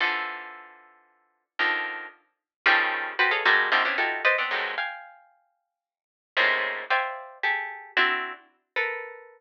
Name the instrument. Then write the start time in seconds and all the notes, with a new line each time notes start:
pizzicato strings
0.00 D3 E3 F3
1.59 D3 D#3 F3
2.66 C#3 D#3 F3 G3 A3
3.19 F#4 G4 A4 B4 C5
3.31 G#4 A4 B4 C#5 D#5 F5
3.45 F#3 G3 G#3 A3 A#3
3.72 C3 D3 D#3 F3 G3
3.85 B3 C4 C#4 D4 E4 F4
3.98 D#4 E4 F4 F#4 G4 A4
4.25 B4 C5 D5 D#5
4.38 B3 C4 D4
4.51 F2 F#2 G2 G#2 A2 B2
4.78 F5 G5 G#5
6.37 G#2 A2 A#2 C3 C#3
6.90 C5 D5 E5 F5 G5 G#5
7.43 G4 G#4 A4
7.97 C4 D4 E4 F#4
8.76 A4 A#4 B4